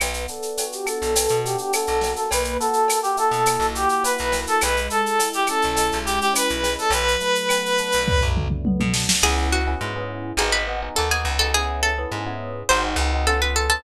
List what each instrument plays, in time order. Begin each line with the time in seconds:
0.00 electric bass (finger) B1, electric piano 1 B3, clarinet B4, cowbell, claves, shaker
0.14 shaker
0.28 electric piano 1 D4, clarinet A4, shaker
0.42 shaker
0.57 electric piano 1 F#4, cowbell, shaker
0.72 clarinet G4, shaker
0.86 electric piano 1 A4, clarinet A4, claves, shaker
1.02 electric bass (finger) B1, shaker
1.15 electric piano 1 B3, cowbell, shaker
1.28 electric bass (finger) B2, shaker
1.44 electric piano 1 D4, clarinet G4, shaker
1.58 clarinet G4, shaker
1.73 electric piano 1 F#4, clarinet A4, cowbell, claves, shaker
1.87 electric bass (finger) B1, shaker
2.01 electric piano 1 A#3, snare, cowbell, shaker
2.16 clarinet A4, shaker
2.31 electric bass (finger) B1, clarinet B4, cowbell, shaker
2.44 shaker
2.60 electric piano 1 F#4, clarinet A4, shaker
2.73 shaker
2.88 electric piano 1 A#3, cowbell, claves, shaker
3.03 clarinet G4, shaker
3.17 electric piano 1 E4, clarinet A4, shaker
3.31 electric bass (finger) B2, shaker
3.46 electric piano 1 A#3, cowbell, claves, shaker
3.59 electric bass (finger) B1, shaker
3.75 electric piano 1 F#4, clarinet G4, shaker
3.89 clarinet G4, shaker
4.03 electric piano 1 E4, clarinet B4, cowbell, shaker
4.18 electric bass (finger) B1, shaker
4.32 electric piano 1 A#3, snare, cowbell, shaker
4.47 clarinet A4, shaker
4.61 electric bass (finger) B1, electric piano 1 G#3, clarinet B4, cowbell, claves, shaker
4.77 shaker
4.90 electric piano 1 E4, clarinet A4, shaker
5.06 shaker
5.19 electric piano 1 G#3, cowbell, shaker
5.33 clarinet G4, shaker
5.47 electric piano 1 C#4, clarinet A4, claves, shaker
5.62 electric bass (finger) B1, shaker
5.75 electric piano 1 G#3, cowbell, shaker
5.92 electric bass (finger) B1, shaker
6.05 electric piano 1 E4, clarinet G4, shaker
6.20 clarinet G4, shaker
6.34 electric piano 1 C#4, clarinet B4, cowbell, claves, shaker
6.49 electric bass (finger) B1, shaker
6.63 electric piano 1 G#3, snare, cowbell, shaker
6.78 clarinet A4, shaker
6.90 electric bass (finger) B1, electric piano 1 F#3, clarinet B4, cowbell, shaker
7.08 shaker
7.20 electric piano 1 A3, shaker
7.35 shaker
7.49 electric piano 1 B3, cowbell, claves, shaker
7.66 shaker
7.78 electric piano 1 D4, shaker
7.92 electric bass (finger) B1, shaker
8.07 electric piano 1 F#3, kick, floor tom
8.21 electric bass (finger) B1, floor tom
8.36 electric piano 1 A3, mid tom
8.50 mid tom
8.65 electric piano 1 B3, high tom
8.80 electric bass (finger) B2, high tom
8.94 electric piano 1 D4, snare
9.09 snare
9.23 electric bass (finger) C#2, electric piano 1 B3 C#4 E4 G#4, acoustic guitar (steel) G#4
9.52 acoustic guitar (steel) F#4
9.67 electric piano 1 B3 C#4 E4 G#4
9.81 electric bass (finger) G#2, electric piano 1 B3 C#4 E4 G#4
9.96 electric piano 1 B3 C#4 E4 G#4
10.37 electric bass (finger) G#1, electric piano 1 B3 D#4 F#4 G#4, acoustic guitar (steel) G#4
10.52 acoustic guitar (steel) B4
10.68 electric piano 1 B3 D#4 F#4 G#4
10.82 electric piano 1 B3 D#4 F#4 G#4
10.95 electric bass (finger) D#2, electric piano 1 B3 D#4 F#4 G#4, acoustic guitar (steel) A4
11.10 electric piano 1 B3 D#4 F#4 G#4, acoustic guitar (steel) G#4
11.25 electric bass (finger) C#2
11.39 electric piano 1 B3 D#4 F#4 G#4, acoustic guitar (steel) A4
11.54 electric piano 1 B3 C#4 E4 G#4, acoustic guitar (steel) G#4
11.83 acoustic guitar (steel) A4
11.98 electric piano 1 B3 C#4 E4 G#4
12.12 electric bass (finger) G#2, electric piano 1 B3 C#4 E4 G#4
12.26 electric piano 1 B3 C#4 E4 G#4
12.69 electric bass (finger) G#1, electric piano 1 C4 D#4 F#4 G#4, acoustic guitar (steel) C5
12.96 electric bass (finger) C#2, electric piano 1 C4 D#4 F#4 G#4
13.13 electric piano 1 C4 D#4 F#4 G#4
13.27 electric piano 1 B3 C#4 F4 G#4, acoustic guitar (steel) A4
13.42 electric piano 1 B3 C#4 F4 G#4, acoustic guitar (steel) B4
13.56 acoustic guitar (steel) A4
13.70 electric piano 1 B3 C#4 F4 G#4, acoustic guitar (steel) A4